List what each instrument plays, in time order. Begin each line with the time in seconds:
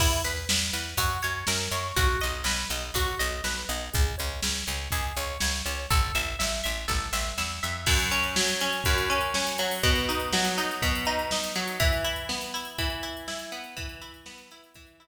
0.00 electric bass (finger) E2, overdriven guitar E4, kick, crash
0.24 electric bass (finger) E2, overdriven guitar B4, closed hi-hat
0.49 electric bass (finger) E2, overdriven guitar B4, snare
0.73 electric bass (finger) E2, overdriven guitar B4, closed hi-hat
0.97 electric bass (finger) F#2, overdriven guitar F#4, kick, closed hi-hat
1.22 electric bass (finger) F#2, overdriven guitar C#5, closed hi-hat
1.47 electric bass (finger) F#2, overdriven guitar A#4, snare
1.71 electric bass (finger) F#2, overdriven guitar C#5, closed hi-hat
1.96 electric bass (finger) B1, overdriven guitar F#4, kick, closed hi-hat
2.21 electric bass (finger) B1, overdriven guitar D#5, closed hi-hat
2.44 electric bass (finger) B1, overdriven guitar B4, snare
2.70 electric bass (finger) B1, overdriven guitar D#5, closed hi-hat
2.94 electric bass (finger) B1, overdriven guitar F#4, kick, closed hi-hat
3.19 electric bass (finger) B1, overdriven guitar D#5, closed hi-hat
3.44 electric bass (finger) B1, overdriven guitar B4, snare
3.69 electric bass (finger) B1, overdriven guitar D#5, closed hi-hat
3.93 electric bass (finger) C#2, overdriven guitar G#4, kick, closed hi-hat
4.18 electric bass (finger) C#2, overdriven guitar C#5, closed hi-hat
4.42 electric bass (finger) C#2, overdriven guitar C#5, snare
4.67 electric bass (finger) C#2, overdriven guitar C#5, closed hi-hat
4.91 electric bass (finger) C#2, overdriven guitar G#4, kick, closed hi-hat
5.16 electric bass (finger) C#2, overdriven guitar C#5, closed hi-hat
5.40 electric bass (finger) C#2, overdriven guitar C#5, snare
5.66 electric bass (finger) C#2, overdriven guitar C#5, closed hi-hat
5.90 electric bass (finger) A1, overdriven guitar A4, kick, closed hi-hat
6.15 electric bass (finger) A1, overdriven guitar E5, closed hi-hat
6.39 electric bass (finger) A1, overdriven guitar E5, snare
6.64 electric bass (finger) A1, overdriven guitar E5, closed hi-hat
6.88 electric bass (finger) A1, overdriven guitar A4, kick, snare
7.13 electric bass (finger) A1, overdriven guitar E5, snare
7.38 electric bass (finger) E2, overdriven guitar E5, snare
7.63 electric bass (finger) F2, overdriven guitar E5
7.86 overdriven guitar F#2, kick, crash
7.99 closed hi-hat
8.11 overdriven guitar C#4, closed hi-hat
8.23 closed hi-hat
8.36 overdriven guitar F#3, snare
8.48 closed hi-hat
8.61 overdriven guitar C#4, closed hi-hat
8.72 closed hi-hat
8.84 overdriven guitar F#2, kick, closed hi-hat
8.98 closed hi-hat
9.10 overdriven guitar C#4, closed hi-hat
9.21 closed hi-hat
9.34 overdriven guitar C#4, snare
9.47 closed hi-hat
9.58 overdriven guitar F#3, closed hi-hat
9.71 open hi-hat
9.83 overdriven guitar B2, kick, closed hi-hat
9.95 closed hi-hat
10.09 overdriven guitar D#4, closed hi-hat
10.20 closed hi-hat
10.33 overdriven guitar F#3, snare
10.45 closed hi-hat
10.58 overdriven guitar D#4, closed hi-hat
10.71 closed hi-hat
10.82 overdriven guitar B2, kick, closed hi-hat
10.95 closed hi-hat
11.05 overdriven guitar D#4, closed hi-hat
11.19 closed hi-hat
11.31 overdriven guitar D#4, snare
11.44 closed hi-hat
11.55 overdriven guitar F#3, closed hi-hat
11.68 closed hi-hat
11.80 overdriven guitar E3, kick, closed hi-hat
11.93 closed hi-hat
12.04 overdriven guitar E4, closed hi-hat
12.16 closed hi-hat
12.29 overdriven guitar B3, snare
12.41 closed hi-hat
12.54 overdriven guitar E4, closed hi-hat
12.65 closed hi-hat
12.78 overdriven guitar E3, kick, closed hi-hat
12.90 closed hi-hat
13.03 overdriven guitar E4, closed hi-hat
13.17 closed hi-hat
13.28 overdriven guitar E4, snare
13.39 closed hi-hat
13.52 overdriven guitar B3, closed hi-hat
13.64 closed hi-hat
13.77 overdriven guitar E3, kick, closed hi-hat
13.89 closed hi-hat
14.02 overdriven guitar E4, closed hi-hat
14.14 closed hi-hat
14.26 overdriven guitar B3, snare
14.38 closed hi-hat
14.51 overdriven guitar E4, closed hi-hat
14.64 closed hi-hat
14.74 overdriven guitar E3, kick, closed hi-hat
14.87 closed hi-hat
15.00 overdriven guitar E4, closed hi-hat